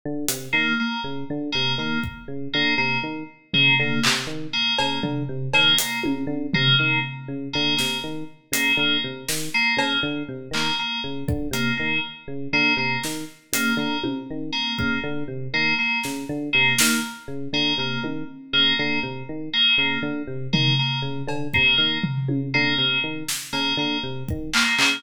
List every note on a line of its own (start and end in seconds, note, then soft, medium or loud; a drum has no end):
0.06 0.26 D3 medium
0.29 0.49 C3 medium
0.29 closed hi-hat loud
0.53 0.73 D#3 medium
0.53 0.73 A#3 medium
0.80 1.00 A#3 medium
1.04 1.24 C#3 medium
1.30 1.50 D3 medium
1.52 1.75 C3 medium
1.52 1.72 A#3 medium
1.78 1.98 D#3 medium
1.78 1.99 A#3 medium
2.04 kick medium
2.28 2.48 C#3 medium
2.54 2.75 D3 medium
2.54 2.74 A#3 medium
2.78 2.98 C3 medium
2.78 2.98 A#3 medium
3.03 3.23 D#3 medium
3.54 3.74 C#3 medium
3.54 3.74 A#3 medium
3.54 floor tom medium
3.80 4.00 D3 medium
3.80 4.00 A#3 medium
4.04 4.26 C3 medium
4.04 clap loud
4.27 4.47 D#3 medium
4.53 4.73 A#3 medium
4.79 4.99 C#3 medium
4.79 4.99 A#3 medium
4.79 cowbell loud
5.03 5.23 D3 medium
5.03 floor tom medium
5.29 5.49 C3 medium
5.54 5.74 D#3 medium
5.54 5.74 A#3 medium
5.54 cowbell loud
5.79 5.99 A#3 medium
5.79 closed hi-hat loud
6.04 6.25 C#3 medium
6.04 high tom medium
6.27 6.47 D3 medium
6.54 6.75 C3 medium
6.54 6.74 A#3 medium
6.54 floor tom loud
6.79 6.99 D#3 medium
6.79 6.99 A#3 medium
7.28 7.48 C#3 medium
7.53 7.75 D3 medium
7.53 7.73 A#3 medium
7.77 8.00 C3 medium
7.77 7.97 A#3 medium
7.77 snare medium
8.04 8.24 D#3 medium
8.52 8.72 C#3 medium
8.52 8.73 A#3 medium
8.52 closed hi-hat loud
8.77 8.97 D3 medium
8.77 8.99 A#3 medium
9.04 9.24 C3 medium
9.29 9.49 D#3 medium
9.29 snare medium
9.54 9.74 A#3 medium
9.77 9.97 C#3 medium
9.77 9.99 A#3 medium
9.77 cowbell loud
10.03 10.23 D3 medium
10.29 10.49 C3 medium
10.51 10.71 D#3 medium
10.51 10.74 A#3 medium
10.51 clap medium
10.79 10.99 A#3 medium
11.04 11.24 C#3 medium
11.28 11.48 D3 medium
11.28 kick medium
11.51 11.71 C3 medium
11.51 11.73 A#3 medium
11.51 closed hi-hat medium
11.77 12.00 D#3 medium
11.77 11.97 A#3 medium
12.28 12.48 C#3 medium
12.53 12.73 D3 medium
12.53 12.73 A#3 medium
12.77 12.97 C3 medium
12.77 12.98 A#3 medium
13.04 13.24 D#3 medium
13.04 snare medium
13.53 13.73 C#3 medium
13.53 13.74 A#3 medium
13.53 closed hi-hat loud
13.77 13.97 D3 medium
13.77 13.99 A#3 medium
14.04 14.24 C3 medium
14.04 high tom medium
14.31 14.51 D#3 medium
14.53 14.72 A#3 medium
14.78 14.99 C#3 medium
14.78 14.98 A#3 medium
14.78 kick medium
15.04 15.24 D3 medium
15.28 15.48 C3 medium
15.54 15.74 D#3 medium
15.54 15.74 A#3 medium
15.79 15.99 A#3 medium
16.04 16.25 C#3 medium
16.04 snare medium
16.29 16.49 D3 medium
16.53 16.74 C3 medium
16.53 16.73 A#3 medium
16.79 17.00 D#3 medium
16.79 16.99 A#3 medium
16.79 snare loud
17.28 17.48 C#3 medium
17.53 17.73 D3 medium
17.53 17.74 A#3 medium
17.78 17.98 C3 medium
17.78 17.99 A#3 medium
18.04 18.24 D#3 medium
18.04 high tom medium
18.53 18.73 C#3 medium
18.53 18.73 A#3 medium
18.79 18.99 D3 medium
18.79 18.99 A#3 medium
19.03 19.23 C3 medium
19.29 19.49 D#3 medium
19.53 19.73 A#3 medium
19.78 19.98 C#3 medium
19.78 19.99 A#3 medium
20.02 20.23 D3 medium
20.27 20.48 C3 medium
20.53 20.74 D#3 medium
20.53 20.73 A#3 medium
20.53 floor tom loud
20.79 20.99 A#3 medium
21.02 21.22 C#3 medium
21.27 21.48 D3 medium
21.27 cowbell medium
21.54 21.75 C3 medium
21.54 21.74 A#3 medium
21.54 kick medium
21.78 21.98 D#3 medium
21.78 21.98 A#3 medium
22.04 floor tom medium
22.28 22.48 C#3 medium
22.28 high tom medium
22.54 22.75 D3 medium
22.54 22.74 A#3 medium
22.78 22.98 C3 medium
22.78 22.98 A#3 medium
23.04 23.24 D#3 medium
23.29 snare medium
23.53 23.73 C#3 medium
23.53 23.73 A#3 medium
23.53 cowbell medium
23.77 23.97 D3 medium
23.77 23.99 A#3 medium
24.03 24.23 C3 medium
24.29 24.50 D#3 medium
24.29 kick medium
24.54 24.74 A#3 medium
24.54 clap loud
24.78 24.99 C#3 medium
24.78 24.98 A#3 medium
24.78 clap loud